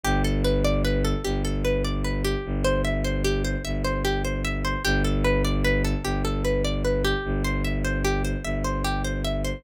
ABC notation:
X:1
M:6/8
L:1/8
Q:3/8=100
K:Gmix
V:1 name="Pizzicato Strings"
G A B d B A | G A B d B G- | G c e c G c | e c G c e c |
G A B d B A | G A B d B G- | G c e c G c | e c G c e c |]
V:2 name="Violin" clef=bass
G,,,6 | G,,,6 | G,,,6 | G,,,6 |
G,,,6 | G,,,6 | G,,,6 | G,,,6 |]